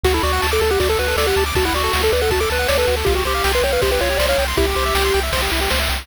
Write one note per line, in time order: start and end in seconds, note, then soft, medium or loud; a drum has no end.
0.03 0.19 D2 medium
0.03 0.13 F#4 medium
0.03 0.14 F#4 medium
0.03 kick medium
0.03 crash medium
0.14 0.23 E4 medium
0.14 0.22 A4 medium
0.23 0.39 D2 medium
0.23 0.47 F#4 medium
0.23 0.32 D5 medium
0.23 ride medium
0.33 0.41 F#5 medium
0.42 0.59 D2 medium
0.42 0.51 A5 medium
0.42 snare medium
0.52 0.61 A4 medium
0.52 0.60 D6 medium
0.61 0.77 D2 medium
0.61 0.71 A4 medium
0.61 0.69 A5 medium
0.61 ride medium
0.70 0.80 G4 medium
0.70 0.79 F#5 medium
0.80 0.96 D2 medium
0.80 0.89 F#4 medium
0.80 0.88 D5 medium
0.80 kick medium
0.80 ride medium
0.89 0.98 A4 medium
0.89 0.99 A4 medium
0.99 1.15 D2 medium
0.99 1.07 F#4 medium
0.99 1.16 B4 medium
0.99 ride medium
1.08 1.17 A4 medium
1.16 1.32 D2 medium
1.16 1.26 A4 medium
1.16 1.26 D5 medium
1.16 snare medium
1.26 1.44 G4 medium
1.26 1.36 F#5 medium
1.36 1.52 D2 medium
1.36 1.45 A5 medium
1.36 ride medium
1.46 1.54 D6 medium
1.55 1.71 D2 medium
1.55 1.65 F#4 medium
1.55 1.64 A5 medium
1.55 kick medium
1.55 ride medium
1.65 1.74 E4 medium
1.65 1.73 F#5 medium
1.73 1.89 D2 medium
1.73 2.02 F#4 medium
1.73 1.83 D5 medium
1.73 ride medium
1.84 1.92 A4 medium
1.93 2.10 D2 medium
1.93 2.02 F#4 medium
1.93 snare medium
2.03 2.11 A4 medium
2.03 2.13 A4 medium
2.12 2.28 D2 medium
2.12 2.22 B4 medium
2.12 2.20 D5 medium
2.12 ride medium
2.21 2.31 A4 medium
2.21 2.30 F#5 medium
2.30 2.46 D2 medium
2.30 2.41 F#4 medium
2.30 2.39 A5 medium
2.30 kick medium
2.30 ride medium
2.40 2.50 A4 medium
2.40 2.49 D6 medium
2.50 2.66 D2 medium
2.50 2.68 B4 medium
2.50 2.58 A5 medium
2.50 ride medium
2.59 2.68 F#5 medium
2.68 2.85 D2 medium
2.68 2.77 C#5 medium
2.68 2.77 D5 medium
2.68 snare medium
2.78 2.86 A4 medium
2.78 2.96 B4 medium
2.87 3.04 D2 medium
2.87 2.96 F#4 medium
2.87 ride medium
2.97 3.05 A4 medium
3.05 3.23 C2 medium
3.05 3.15 F4 medium
3.05 3.14 G4 medium
3.05 kick medium
3.05 ride medium
3.15 3.24 F#4 medium
3.15 3.24 G4 medium
3.25 3.41 C2 medium
3.25 3.52 G4 medium
3.25 3.34 C5 medium
3.25 ride medium
3.35 3.43 F5 medium
3.44 3.61 C2 medium
3.44 3.53 G5 medium
3.44 snare medium
3.53 3.64 B4 medium
3.53 3.62 C6 medium
3.62 3.78 C2 medium
3.62 3.73 C#5 medium
3.62 3.71 G5 medium
3.62 ride medium
3.72 3.82 B4 medium
3.72 3.81 F5 medium
3.82 3.99 C2 medium
3.82 3.91 G4 medium
3.82 3.90 C5 medium
3.82 kick medium
3.82 ride medium
3.91 4.00 G4 medium
3.91 4.01 B4 medium
4.01 4.17 C2 medium
4.01 4.09 F4 medium
4.01 4.18 C#5 medium
4.01 ride medium
4.10 4.19 G4 medium
4.17 4.35 C2 medium
4.17 4.28 C5 medium
4.17 4.26 D5 medium
4.17 snare medium
4.28 4.45 C#5 medium
4.28 4.37 F5 medium
4.38 4.54 C2 medium
4.38 4.47 G5 medium
4.38 ride medium
4.48 4.56 C6 medium
4.57 4.74 C2 medium
4.57 4.66 E4 medium
4.57 5.20 G4 medium
4.57 kick medium
4.57 ride medium
4.67 4.75 G4 medium
4.76 4.92 C2 medium
4.76 4.85 C5 medium
4.76 ride medium
4.86 4.94 E5 medium
4.95 5.11 C2 medium
4.95 5.03 G5 medium
4.95 snare medium
5.04 5.13 C6 medium
5.14 5.31 C2 medium
5.14 5.22 G5 medium
5.14 ride medium
5.23 5.32 E5 medium
5.32 5.48 C2 medium
5.32 5.41 C5 medium
5.32 kick medium
5.32 ride loud
5.42 5.51 G4 medium
5.52 5.68 C2 medium
5.52 5.60 E4 medium
5.52 ride medium
5.61 5.69 G4 medium
5.70 5.89 C#2 medium
5.70 5.79 C5 medium
5.70 snare medium
5.80 5.88 E5 medium
5.89 6.06 C2 medium
5.89 5.98 G5 medium
5.89 ride medium
5.99 6.07 C6 medium